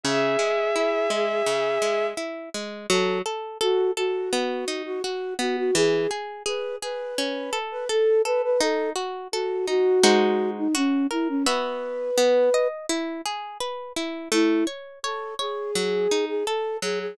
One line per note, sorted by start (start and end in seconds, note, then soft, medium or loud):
0.03 0.37 C#3 medium
0.03 2.06 G#4 medium
0.03 2.06 E5 medium
0.39 0.71 G#3 medium
0.76 1.08 E4 medium
1.10 1.42 G#3 medium
1.46 1.78 C#3 medium
1.82 2.14 G#3 medium
2.17 2.49 E4 medium
2.54 2.86 G#3 medium
2.89 3.22 F#3 loud
2.89 3.19 A4 medium
3.26 3.58 A4 medium
3.61 3.91 F#4 medium
3.61 3.93 A4 loud
3.97 4.82 F#4 medium
3.97 4.29 A4 medium
4.33 4.65 B3 loud
4.68 5.00 D#4 medium
4.85 5.02 F#4 medium
5.04 5.34 F#4 medium
5.04 5.36 F#4 medium
5.39 5.71 B3 medium
5.39 5.56 F#4 medium
5.57 5.74 F#4 medium
5.75 6.07 E3 loud
5.75 6.10 G#4 medium
6.11 6.43 G#4 medium
6.46 6.78 G#4 medium
6.46 6.76 B4 medium
6.82 7.14 G#4 medium
6.82 7.59 B4 medium
7.18 7.50 C#4 loud
7.53 7.85 A4 medium
7.71 7.88 B4 medium
7.89 8.21 A4 medium
7.89 8.22 A4 medium
8.25 8.57 A4 medium
8.25 8.42 B4 medium
8.43 8.60 B4 medium
8.60 8.93 D#4 loud
8.60 8.90 A4 medium
8.96 9.28 F#4 medium
9.32 9.66 F#4 medium
9.32 9.65 A4 medium
9.67 10.00 D#4 medium
9.67 10.50 F#4 medium
10.03 10.68 G#3 loud
10.03 10.68 D#4 loud
10.03 10.68 F#4 loud
10.03 10.68 C5 loud
10.57 10.74 D#4 medium
10.75 11.07 C#4 medium
10.75 11.07 F#4 loud
11.11 11.28 E4 medium
11.11 11.43 A#4 medium
11.29 11.46 C#4 medium
11.46 12.11 B3 loud
11.46 12.11 F#4 medium
11.46 12.68 B4 medium
11.46 12.11 E5 loud
12.17 12.50 B3 loud
12.54 12.86 D#5 medium
12.89 13.21 E4 loud
13.25 13.58 G#4 medium
13.60 13.92 B4 medium
13.96 14.28 E4 medium
14.32 14.64 A3 loud
14.32 14.66 E4 medium
14.67 14.99 C#5 medium
15.03 15.34 A4 medium
15.03 15.36 C#5 medium
15.39 16.25 G#4 medium
15.39 15.71 C#5 medium
15.75 16.07 F#3 medium
16.11 16.43 D#4 medium
16.28 16.45 G#4 medium
16.46 16.77 A4 medium
16.46 16.79 A4 medium
16.82 17.14 F#3 medium
16.82 16.99 G#4 medium
17.00 17.17 G#4 medium